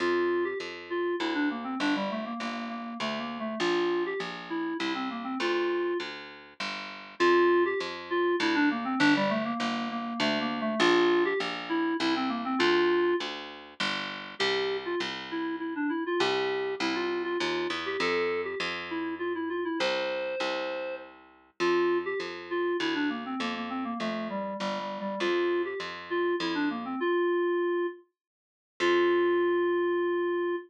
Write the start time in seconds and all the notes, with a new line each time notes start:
0.00 F2 F4
0.44 G4
0.60 F2
0.90 F4
1.20 D2 E4
1.34 D4
1.51 A#3
1.64 C4
1.80 G1 D4
1.96 G3
2.10 A3
2.25 A#3
2.40 G1 A#3
2.69 A#3
3.00 D2 A3
3.19 A#3
3.40 A3
3.60 A#1 F4
4.06 G4
4.20 A#1
4.50 E4
4.79 C2 E4
4.95 C4
5.10 A#3
5.24 C4
5.40 D2 F4
6.00 D2
6.60 G1
7.20 F2 F4
7.65 G4
7.80 F2
8.10 F4
8.40 D2 E4
8.55 D4
8.71 A#3
8.85 C4
8.99 G1 D4
9.16 G3
9.30 A3
9.45 A#3
9.59 G1 A#3
9.91 A#3
10.20 D2 A3
10.41 A#3
10.61 A3
10.80 A#1 F4
11.25 G4
11.40 A#1
11.69 E4
12.00 C2 E4
12.16 C4
12.29 A#3
12.45 C4
12.59 D2 F4
13.20 D2
13.80 G1
14.39 C2 G4
14.85 F4
15.00 C2
15.31 E4
15.60 E4
15.76 D4
15.89 E4
16.06 F4
16.20 C2 G4
16.80 C2 E4
16.95 F4
17.24 F4
17.40 D#2 F4
17.70 E2
17.86 G4
18.00 F2 A4
18.44 G4
18.60 F2
18.90 E4
19.19 F4
19.35 E4
19.49 F4
19.65 E4
19.79 C2 C5
20.40 C2
21.60 F2 F4
22.05 G4
22.20 F2
22.50 F4
22.80 D2 E4
22.95 D4
23.09 A#3
23.25 C4
23.40 F2 A#3
23.55 A#3
23.70 C4
23.84 A#3
24.00 F2 A3
24.30 G3
24.60 G1 G3
24.79 G3
25.00 G3
25.20 F2 F4
25.65 G4
25.80 F2
26.10 F4
26.40 F2 E4
26.55 D4
26.70 A#3
26.85 C4
27.00 F4
28.80 F2 F4